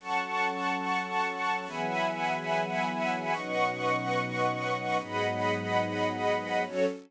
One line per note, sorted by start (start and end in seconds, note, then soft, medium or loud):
0.00 1.65 F#3 medium
0.00 1.65 C#4 medium
0.00 1.65 A4 medium
0.00 1.65 F#5 medium
0.00 1.65 A5 medium
0.00 1.65 C#6 medium
1.67 3.32 E3 medium
1.67 3.32 F#3 medium
1.67 3.32 B3 medium
1.67 3.32 G#4 medium
1.67 3.33 E5 medium
1.67 3.32 F#5 medium
1.67 3.33 G#5 medium
1.67 3.33 B5 medium
3.32 4.98 B2 medium
3.32 4.98 F#3 medium
3.32 4.98 C#4 medium
3.32 4.98 D#4 medium
3.32 4.97 B4 medium
3.32 4.97 D#5 medium
3.32 4.97 F#5 medium
3.32 4.97 C#6 medium
4.99 6.65 G#2 medium
4.99 6.65 F#3 medium
4.99 6.65 B3 medium
4.99 6.65 D#4 medium
4.99 6.64 G#4 medium
4.99 6.64 D#5 medium
4.99 6.64 F#5 medium
4.99 6.64 B5 medium
6.66 6.86 F#3 medium
6.66 6.86 C#4 loud
6.66 6.86 F#4 loud
6.66 6.86 A4 medium
6.66 6.86 C#5 loud